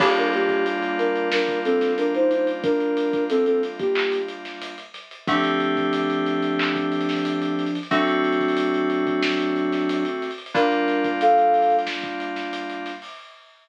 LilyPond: <<
  \new Staff \with { instrumentName = "Ocarina" } { \time 4/4 \key g \minor \tempo 4 = 91 <bes g'>16 <d' bes'>16 <bes g'>8 r8 <d' bes'>8 <d' bes'>8 <c' a'>8 <d' bes'>16 <ees' c''>16 <ees' c''>16 r16 | <d' bes'>4 <c' a'>16 <c' a'>16 r16 <bes g'>8. r4. | <f d'>1 | <fis d'>1 |
<d' bes'>4 <a' f''>4 r2 | }
  \new Staff \with { instrumentName = "Electric Piano 2" } { \time 4/4 \key g \minor <g bes d' f'>1~ | <g bes d' f'>1 | <d a c' g'>1 | <d a c' fis'>1 |
<g bes d' f'>1 | }
  \new DrumStaff \with { instrumentName = "Drums" } \drummode { \time 4/4 <cymc bd>16 hh16 hh16 <hh bd>16 hh16 hh16 hh16 hh16 sn16 <hh bd>16 hh16 <hh sn>16 hh16 hh16 hh16 hh16 | <hh bd>16 hh16 hh16 <hh bd>16 hh16 hh16 hh16 <hh bd>16 hc16 hh16 hh16 <hh sn>16 hh16 hh16 <hh sn>16 hh16 | <hh bd>16 <hh sn>16 hh16 <hh bd>16 hh16 hh16 hh16 hh16 hc16 <hh bd>16 hh32 hh32 <hh sn>32 hh32 hh16 hh16 hh32 hh32 hh32 hh32 | <hh bd>16 hh16 hh32 hh32 <hh bd>32 hh32 hh16 hh16 hh16 <hh bd>16 sn16 hh16 hh16 <hh sn>16 hh16 hh16 hh32 hh32 hh32 hh32 |
<hh bd>16 hh16 <hh sn>16 <hh bd>16 hh16 hh16 hh32 hh32 hh32 hh32 sn16 <hh bd>16 hh16 <hh sn>16 hh16 hh16 <hh sn>16 hho16 | }
>>